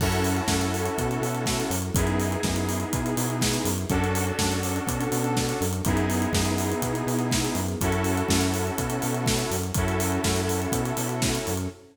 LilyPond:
<<
  \new Staff \with { instrumentName = "Lead 2 (sawtooth)" } { \time 4/4 \key fis \minor \tempo 4 = 123 <cis' e' fis' a'>1 | <b dis' e' gis'>1 | <cis' d' fis' a'>1 | <b dis' e' gis'>1 |
<cis' e' fis' a'>1 | <cis' e' fis' a'>1 | }
  \new Staff \with { instrumentName = "Synth Bass 1" } { \clef bass \time 4/4 \key fis \minor fis,4 fis,4 b,8 b,4 fis,8 | fis,4 fis,4 b,8 b,4 fis,8 | fis,4 fis,4 b,8 b,4 fis,8 | fis,4 fis,4 b,8 b,4 fis,8 |
fis,4 fis,4 b,8 b,4 fis,8 | fis,4 fis,4 b,8 b,4 fis,8 | }
  \new Staff \with { instrumentName = "String Ensemble 1" } { \time 4/4 \key fis \minor <cis' e' fis' a'>1 | <b dis' e' gis'>1 | <cis' d' fis' a'>1 | <b dis' e' gis'>1 |
<cis' e' fis' a'>1 | <cis' e' fis' a'>1 | }
  \new DrumStaff \with { instrumentName = "Drums" } \drummode { \time 4/4 <cymc bd>16 hh16 hho16 hh16 <bd sn>16 hh16 hho16 hh16 <hh bd>16 hh16 hho16 hh16 <bd sn>16 hh16 hho16 hh16 | <hh bd>16 hh16 hho16 hh16 <bd sn>16 hh16 hho16 hh16 <hh bd>16 hh16 hho16 hh16 <bd sn>16 hh16 hho16 hh16 | <hh bd>16 hh16 hho16 hh16 <bd sn>16 hh16 hho16 hh16 <hh bd>16 hh16 hho16 hh16 <bd sn>16 hh16 hho16 hh16 | <hh bd>16 hh16 hho16 hh16 <bd sn>16 hh16 hho16 hh16 <hh bd>16 hh16 hho16 hh16 <bd sn>16 hh16 hho16 hh16 |
<hh bd>16 hh16 hho16 hh16 <bd sn>16 hh16 hho16 hh16 <hh bd>16 hh16 hho16 hh16 <bd sn>16 hh16 hho16 hh16 | <hh bd>16 hh16 hho16 hh16 <bd sn>16 hh16 hho16 hh16 <hh bd>16 hh16 hho16 hh16 <bd sn>16 hh16 hho16 hh16 | }
>>